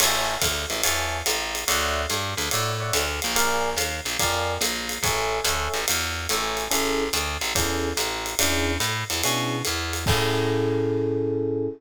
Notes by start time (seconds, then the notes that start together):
0.00 A1 C#5 E5 G#5 A5, crash, ride
0.42 D2, kick, hi-hat pedal, ride
0.70 A1, ride
0.83 E2 C#5 E5 G#5 A5, ride
1.26 A1, hi-hat pedal, ride
1.55 ride
1.68 D2 C#5 D5 E5 F#5, ride
2.10 G2, hi-hat pedal, ride
2.37 D2, ride
2.51 A2 C#5 D5 E5 F#5, ride
2.80 C#5 D5 E5 F#5
2.93 D2, hi-hat pedal, ride
3.22 A#1, ride
3.36 A#4 D5 F5 G#5, ride
3.77 D#2, hi-hat pedal, ride
4.05 A#1, ride
4.19 F2 A#4 D5 F5 G#5, kick, ride
4.61 A#1, hi-hat pedal, ride
4.89 ride
5.03 A1 A4 C#5 E5 G#5, kick, ride
5.44 D2 A4 C#5 E5 G#5, hi-hat pedal, ride
5.74 A1, ride
5.88 E2, ride
6.29 A1 A4 C#5 E5 G#5, hi-hat pedal, ride
6.57 ride
6.70 A1 C#4 E4 G#4 A4, ride
7.13 D2, hi-hat pedal, ride
7.41 A1, ride
7.55 E2 C#4 E4 G#4 A4, kick, ride
7.97 A1, hi-hat pedal, ride
8.26 ride
8.39 E2 C#4 D4 E4 G#4, ride
8.80 A2, hi-hat pedal, ride
9.10 E2, ride
9.23 B2 C#4 D4 E4 G#4, ride
9.65 E2, hi-hat pedal, ride
9.93 ride
10.06 A2 C#4 E4 G#4 A4, kick, crash